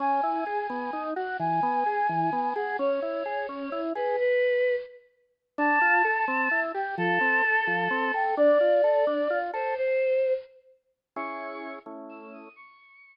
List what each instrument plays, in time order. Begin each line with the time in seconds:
0.00 drawbar organ C#4, choir aahs G#5
0.23 drawbar organ E4
0.46 drawbar organ G#4
0.70 drawbar organ B3
0.93 drawbar organ D#4
1.16 drawbar organ F#4, choir aahs F#5
1.40 drawbar organ E3, choir aahs G#5
1.63 drawbar organ B3
1.86 drawbar organ G#4
2.09 drawbar organ E3
2.33 drawbar organ B3
2.56 drawbar organ G#4, choir aahs F#5
2.79 drawbar organ C#4, choir aahs C#5
3.02 drawbar organ E4
3.26 drawbar organ G#4
3.49 drawbar organ C#4
3.72 drawbar organ E4
3.95 drawbar organ G#4, choir aahs B4
4.19 choir aahs B4
5.58 drawbar organ D4, choir aahs A5
5.81 drawbar organ F4
6.05 drawbar organ A4
6.28 drawbar organ C4
6.51 drawbar organ E4
6.74 drawbar organ G4, choir aahs G5
6.98 drawbar organ F3, choir aahs A4
7.21 drawbar organ C4
7.44 drawbar organ A4
7.67 drawbar organ F3
7.91 drawbar organ C4
8.14 drawbar organ A4, choir aahs G5
8.37 drawbar organ D4, choir aahs D5
8.60 drawbar organ F4
8.84 drawbar organ A4
9.07 drawbar organ D4
9.30 drawbar organ F4
9.53 drawbar organ A4, choir aahs C5
9.77 choir aahs C5
11.16 drawbar organ C#4 E4 G#4, choir aahs C#6
11.86 drawbar organ A3 C#4 E4
12.09 choir aahs E6
12.21 choir aahs E6
12.33 choir aahs D#6
12.56 choir aahs C#6